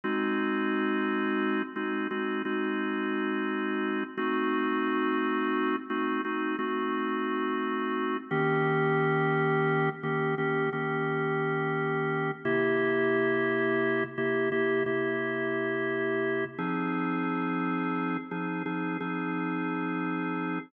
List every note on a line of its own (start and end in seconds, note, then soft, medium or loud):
0.04 1.62 G#3 loud
0.04 1.62 C4 loud
0.04 1.62 D#4 loud
0.04 1.62 F#4 loud
1.76 2.07 G#3 medium
1.76 2.07 C4 medium
1.76 2.07 D#4 medium
1.76 2.07 F#4 medium
2.11 2.42 G#3 medium
2.11 2.42 C4 medium
2.11 2.42 D#4 medium
2.11 2.42 F#4 medium
2.45 4.04 G#3 medium
2.45 4.04 C4 medium
2.45 4.04 D#4 medium
2.45 4.04 F#4 medium
4.17 5.76 A3 loud
4.17 5.76 C4 loud
4.17 5.76 D#4 loud
4.17 5.76 F#4 loud
5.90 6.21 A3 medium
5.90 6.21 C4 loud
5.90 6.21 D#4 loud
5.90 6.21 F#4 medium
6.25 6.56 A3 medium
6.25 6.56 C4 medium
6.25 6.56 D#4 loud
6.25 6.56 F#4 medium
6.59 8.17 A3 medium
6.59 8.17 C4 medium
6.59 8.17 D#4 medium
6.59 8.17 F#4 medium
8.31 9.89 D#3 loud
8.31 9.89 A#3 loud
8.31 9.89 C#4 loud
8.31 9.89 G4 loud
10.03 10.35 D#3 medium
10.03 10.35 A#3 medium
10.03 10.35 C#4 medium
10.03 10.35 G4 medium
10.38 10.70 D#3 medium
10.38 10.70 A#3 medium
10.38 10.70 C#4 medium
10.38 10.70 G4 medium
10.73 12.31 D#3 medium
10.73 12.31 A#3 medium
10.73 12.31 C#4 medium
10.73 12.31 G4 medium
12.45 14.04 C3 loud
12.45 14.04 A#3 loud
12.45 14.04 E4 loud
12.45 14.04 G4 loud
14.18 14.49 C3 medium
14.18 14.49 A#3 loud
14.18 14.49 E4 medium
14.18 14.49 G4 medium
14.52 14.83 C3 medium
14.52 14.83 A#3 medium
14.52 14.83 E4 medium
14.52 14.83 G4 loud
14.86 16.45 C3 medium
14.86 16.45 A#3 medium
14.86 16.45 E4 medium
14.86 16.45 G4 medium
16.58 18.17 F3 medium
16.58 18.17 C4 loud
16.58 18.17 D#4 medium
16.58 18.17 G#4 loud
18.31 18.63 F3 medium
18.31 18.63 C4 medium
18.31 18.63 D#4 medium
18.31 18.63 G#4 medium
18.66 18.97 F3 medium
18.66 18.97 C4 medium
18.66 18.97 D#4 medium
18.66 18.97 G#4 medium
19.00 20.59 F3 medium
19.00 20.59 C4 medium
19.00 20.59 D#4 medium
19.00 20.59 G#4 medium